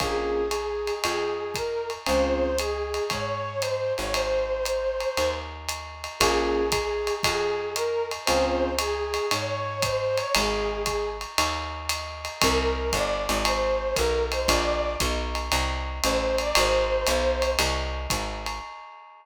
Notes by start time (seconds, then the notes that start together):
0.00 A#1 A#3 C#4 F4 G#4, kick, ride
0.51 hi-hat pedal, ride
0.87 ride
1.04 F2 G#4, ride
1.54 A#4, kick, hi-hat pedal, ride
1.90 ride
2.06 C#2 C4 C#4 F4 G#4 C5, ride
2.59 G#4, hi-hat pedal, ride
2.94 ride
3.10 G#2 C#5, kick, ride
3.61 C5, hi-hat pedal, ride
3.97 G#1 C#5, ride
4.13 C5, ride
4.65 hi-hat pedal, ride
5.00 ride
5.17 D#2, ride
5.69 hi-hat pedal, ride
6.04 ride
6.20 A#1 A#3 C#4 F4 G#4, kick, ride
6.72 kick, hi-hat pedal, ride
7.07 ride
7.23 F2 G#4, kick, ride
7.76 A#4, hi-hat pedal, ride
8.11 ride
8.25 C#2 C4 C#4 F4 G#4 C5, ride
8.79 G#4, hi-hat pedal, ride
9.14 ride
9.31 G#2 C#5, ride
9.82 C5, kick, hi-hat pedal, ride
10.16 C#5, ride
10.35 G#1 G#4, ride
10.86 kick, hi-hat pedal, ride
11.21 ride
11.38 D#2, ride
11.89 hi-hat pedal, ride
12.25 ride
12.41 C2 A#4, kick, ride
12.93 G1 D5, kick, hi-hat pedal, ride
13.29 G#1, ride
13.45 C5, ride
13.95 B1 A#4, kick, hi-hat pedal, ride
14.32 C5, ride
14.47 A#1 D5, kick, ride
15.00 B1, kick, hi-hat pedal, ride
15.35 ride
15.52 C2, ride
16.03 A1 C5, hi-hat pedal, ride
16.38 D5, ride
16.55 G#1 C5, ride
17.07 B1, hi-hat pedal, ride
17.42 ride
17.59 C2, ride
18.10 G#1, kick, hi-hat pedal, ride
18.46 ride